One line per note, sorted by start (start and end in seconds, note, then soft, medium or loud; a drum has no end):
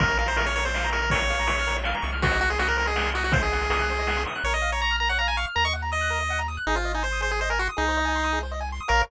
0.00 1.94 A#1 medium
0.00 0.18 A#4 medium
0.00 0.09 A#4 medium
0.00 kick loud
0.00 closed hi-hat loud
0.08 0.16 C#5 medium
0.08 closed hi-hat medium
0.17 0.27 A#4 medium
0.17 0.27 F5 medium
0.17 closed hi-hat medium
0.26 0.37 C5 medium
0.26 0.37 A#5 medium
0.26 closed hi-hat medium
0.36 0.46 A#4 medium
0.36 0.46 C#6 medium
0.36 closed hi-hat loud
0.46 0.55 C#5 medium
0.46 0.54 F6 medium
0.46 closed hi-hat medium
0.55 0.64 A#4 medium
0.55 0.64 C#5 medium
0.55 closed hi-hat medium
0.65 0.90 C5 medium
0.65 0.73 C#5 medium
0.65 closed hi-hat medium
0.74 0.83 F5 medium
0.74 snare medium
0.84 0.92 A#5 medium
0.84 closed hi-hat medium
0.91 1.01 A#4 medium
0.91 1.00 C#6 medium
0.91 closed hi-hat medium
1.01 1.11 A#4 medium
1.01 1.11 F6 medium
1.01 closed hi-hat medium
1.10 1.20 A#4 medium
1.10 1.77 C#5 medium
1.10 kick medium
1.10 closed hi-hat loud
1.20 1.28 C#5 medium
1.20 closed hi-hat medium
1.29 1.37 F5 medium
1.29 closed hi-hat medium
1.39 1.47 A#5 medium
1.39 closed hi-hat medium
1.47 1.56 C#6 medium
1.47 closed hi-hat loud
1.58 1.68 F6 medium
1.58 closed hi-hat medium
1.67 1.75 A#4 medium
1.67 closed hi-hat medium
1.75 1.83 C#5 medium
1.75 closed hi-hat medium
1.84 1.93 F5 medium
1.84 snare loud
1.94 2.03 A#5 medium
1.94 closed hi-hat medium
2.02 4.26 C2 medium
2.02 2.10 C#6 medium
2.02 closed hi-hat medium
2.12 2.21 F6 medium
2.12 closed hi-hat medium
2.22 2.40 F#4 medium
2.22 2.31 C5 medium
2.22 kick loud
2.22 closed hi-hat loud
2.31 2.40 D#5 medium
2.31 closed hi-hat medium
2.41 2.50 F#4 medium
2.41 2.49 F#5 medium
2.41 closed hi-hat medium
2.49 2.59 G#4 medium
2.49 2.58 C6 medium
2.49 closed hi-hat medium
2.59 2.68 F#4 medium
2.59 2.68 D#6 medium
2.59 closed hi-hat medium
2.67 2.77 A#4 medium
2.67 2.77 F#6 medium
2.67 closed hi-hat medium
2.77 2.87 A#4 medium
2.77 2.85 C5 medium
2.77 closed hi-hat medium
2.86 3.10 G#4 medium
2.86 2.96 D#5 medium
2.86 closed hi-hat medium
2.96 3.04 F#5 medium
2.96 snare loud
3.05 3.14 C6 medium
3.05 closed hi-hat medium
3.14 3.24 F#4 medium
3.14 3.23 D#6 medium
3.14 closed hi-hat medium
3.24 3.33 F#4 medium
3.24 3.34 F#6 medium
3.24 closed hi-hat medium
3.32 3.41 C5 medium
3.32 3.42 C5 medium
3.32 kick loud
3.32 closed hi-hat loud
3.42 4.23 G#4 medium
3.42 3.50 D#5 medium
3.42 closed hi-hat medium
3.52 3.60 F#5 medium
3.52 closed hi-hat medium
3.61 3.70 C6 medium
3.61 closed hi-hat medium
3.70 3.79 D#6 medium
3.70 closed hi-hat loud
3.79 3.87 F#6 medium
3.79 closed hi-hat medium
3.89 3.98 C5 medium
3.89 closed hi-hat medium
3.99 4.07 D#5 medium
3.99 closed hi-hat medium
4.07 4.16 F#5 medium
4.07 snare medium
4.17 4.25 C6 medium
4.17 closed hi-hat medium
4.26 4.36 D#6 medium
4.26 closed hi-hat medium
4.35 4.44 F#6 medium
4.35 closed hi-hat medium
4.44 5.46 A#1 medium
4.44 4.54 A#4 medium
4.44 4.53 C#5 medium
4.53 4.61 C#5 medium
4.53 4.71 D#5 medium
4.62 4.70 F5 medium
4.72 4.81 C#5 medium
4.72 4.81 A#5 medium
4.81 4.96 A#5 medium
4.81 4.91 C#6 medium
4.91 4.99 F6 medium
5.00 5.09 A#4 medium
5.00 5.09 A#5 medium
5.09 5.18 C#5 medium
5.09 5.18 F#5 medium
5.19 5.28 F5 medium
5.19 5.27 A#5 medium
5.28 5.37 G#5 medium
5.28 5.37 A#5 medium
5.37 5.46 F5 medium
5.37 5.45 C#6 medium
5.47 5.55 F6 medium
5.55 6.58 D#2 medium
5.55 5.64 A#4 medium
5.55 5.65 A#5 medium
5.65 5.73 D#5 medium
5.65 5.74 C#6 medium
5.73 5.82 F#5 medium
5.82 5.91 A#5 medium
5.92 6.40 D#5 medium
5.92 6.00 D#6 medium
6.01 6.09 F#6 medium
6.10 6.19 A#4 medium
6.20 6.29 D#5 medium
6.30 6.39 F#5 medium
6.39 6.47 A#5 medium
6.48 6.56 D#6 medium
6.57 6.65 F#6 medium
6.67 7.69 G#1 medium
6.67 6.76 D#4 medium
6.67 6.76 G#4 loud
6.75 6.92 F4 medium
6.75 6.84 C5 medium
6.85 6.93 D#5 medium
6.94 7.03 D#4 medium
6.94 7.03 G#5 medium
7.03 7.21 C5 medium
7.03 7.11 C6 medium
7.12 7.21 D#6 medium
7.21 7.29 G#4 medium
7.21 7.31 C5 medium
7.31 7.40 G#4 medium
7.31 7.39 C5 medium
7.41 7.50 C5 medium
7.41 7.50 D#5 medium
7.50 7.59 A#4 medium
7.50 7.58 G#5 medium
7.59 7.68 F#4 medium
7.59 7.69 C6 medium
7.69 7.77 D#6 medium
7.77 8.80 C2 medium
7.77 8.39 D#4 medium
7.77 7.85 G#4 loud
7.88 7.97 C5 medium
7.97 8.05 D#5 medium
8.05 8.13 G#5 medium
8.16 8.24 C6 medium
8.24 8.32 D#6 medium
8.33 8.41 G#4 medium
8.43 8.51 C5 medium
8.52 8.60 D#5 medium
8.60 8.69 G#5 medium
8.72 8.81 C6 medium
8.80 8.89 D#6 medium
8.88 9.03 A#1 loud
8.88 9.01 A#4 medium
8.88 9.02 A#4 loud
8.88 9.01 C#5 medium
8.88 9.01 F5 loud